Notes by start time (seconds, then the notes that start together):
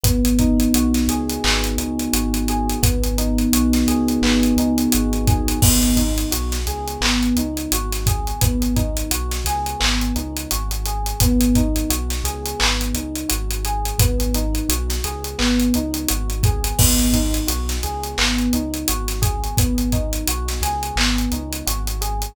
0.03 G#1 B3, kick, closed hi-hat
0.25 closed hi-hat
0.39 D#4, kick, closed hi-hat
0.60 closed hi-hat
0.74 B1 F#4, closed hi-hat
0.94 snare, closed hi-hat
1.07 C#2 G#4, closed hi-hat
1.30 closed hi-hat
1.44 G#1 B3, clap
1.64 closed hi-hat
1.77 C#2 D#4, closed hi-hat
1.99 closed hi-hat
2.13 G#1 F#4, closed hi-hat
2.34 closed hi-hat
2.48 G#4, closed hi-hat
2.69 closed hi-hat
2.83 G#1 B3, kick, closed hi-hat
3.03 closed hi-hat
3.18 D#4, closed hi-hat
3.38 closed hi-hat
3.53 B1 F#4, closed hi-hat
3.73 snare, closed hi-hat
3.87 C#2 G#4, closed hi-hat
4.08 closed hi-hat
4.22 G#1 B3, clap
4.43 closed hi-hat
4.56 C#2 D#4, closed hi-hat
4.78 closed hi-hat
4.92 G#1 F#4, closed hi-hat
5.13 closed hi-hat
5.27 G#4, kick, closed hi-hat
5.48 closed hi-hat
5.62 G#1 B3, kick, crash
5.83 closed hi-hat
5.96 D#4, kick, closed hi-hat
6.18 closed hi-hat
6.31 B1 F#4, closed hi-hat
6.52 snare, closed hi-hat
6.66 C#2 G#4, closed hi-hat
6.87 closed hi-hat
7.01 G#1 B3, clap
7.23 closed hi-hat
7.36 C#2 D#4, closed hi-hat
7.57 closed hi-hat
7.72 G#1 F#4, closed hi-hat
7.92 snare, closed hi-hat
8.06 G#4, kick, closed hi-hat
8.27 closed hi-hat
8.41 G#1 B3, kick, closed hi-hat
8.62 closed hi-hat
8.76 D#4, kick, closed hi-hat
8.97 closed hi-hat
9.11 B1 F#4, closed hi-hat
9.31 snare, closed hi-hat
9.44 C#2 G#4, snare, closed hi-hat
9.66 closed hi-hat
9.80 G#1 B3, clap
10.01 closed hi-hat
10.16 C#2 D#4, closed hi-hat
10.36 closed hi-hat
10.51 G#1 F#4, closed hi-hat
10.71 closed hi-hat
10.85 G#4, closed hi-hat
11.06 closed hi-hat
11.20 G#1 B3, kick, closed hi-hat
11.41 closed hi-hat
11.55 D#4, kick, closed hi-hat
11.76 closed hi-hat
11.90 B1 F#4, closed hi-hat
12.10 snare, closed hi-hat
12.24 C#2 G#4, closed hi-hat
12.45 closed hi-hat
12.59 G#1 B3, clap
12.81 closed hi-hat
12.94 C#2 D#4, closed hi-hat
13.15 closed hi-hat
13.29 G#1 F#4, closed hi-hat
13.51 closed hi-hat
13.65 G#4, closed hi-hat
13.85 closed hi-hat
13.98 G#1 B3, kick, closed hi-hat
14.20 closed hi-hat
14.34 D#4, closed hi-hat
14.55 closed hi-hat
14.69 B1 F#4, closed hi-hat
14.90 snare, closed hi-hat
15.04 C#2 G#4, closed hi-hat
15.24 closed hi-hat
15.39 G#1 B3, clap
15.60 closed hi-hat
15.74 C#2 D#4, closed hi-hat
15.94 closed hi-hat
16.08 G#1 F#4, closed hi-hat
16.30 closed hi-hat
16.43 G#4, kick, closed hi-hat
16.64 closed hi-hat
16.79 G#1 B3, kick, crash
16.99 closed hi-hat
17.13 D#4, kick, closed hi-hat
17.34 closed hi-hat
17.47 B1 F#4, closed hi-hat
17.69 snare, closed hi-hat
17.83 C#2 G#4, closed hi-hat
18.03 closed hi-hat
18.18 G#1 B3, clap
18.38 closed hi-hat
18.53 C#2 D#4, closed hi-hat
18.74 closed hi-hat
18.88 G#1 F#4, closed hi-hat
19.08 snare, closed hi-hat
19.22 G#4, kick, closed hi-hat
19.44 closed hi-hat
19.57 G#1 B3, kick, closed hi-hat
19.78 closed hi-hat
19.92 D#4, kick, closed hi-hat
20.13 closed hi-hat
20.27 B1 F#4, closed hi-hat
20.48 snare, closed hi-hat
20.61 C#2 G#4, snare, closed hi-hat
20.83 closed hi-hat
20.96 G#1 B3, clap
21.18 closed hi-hat
21.32 C#2 D#4, closed hi-hat
21.52 closed hi-hat
21.67 G#1 F#4, closed hi-hat
21.87 closed hi-hat
22.01 G#4, closed hi-hat
22.22 closed hi-hat